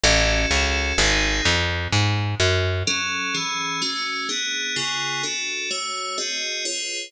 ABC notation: X:1
M:3/4
L:1/8
Q:1/4=127
K:F#m
V:1 name="Electric Piano 2"
[CFA]4 [^B,^DG]2 | z6 | [F,CA]2 [E,CG]2 [A,CF]2 | [B,DG]2 [C,B,^EG]2 [DFA]2 |
[A,Fc]2 [^B,FG^d]2 [^EG=Bc]2 |]
V:2 name="Electric Bass (finger)" clef=bass
A,,,2 C,,2 G,,,2 | ^E,,2 G,,2 F,,2 | z6 | z6 |
z6 |]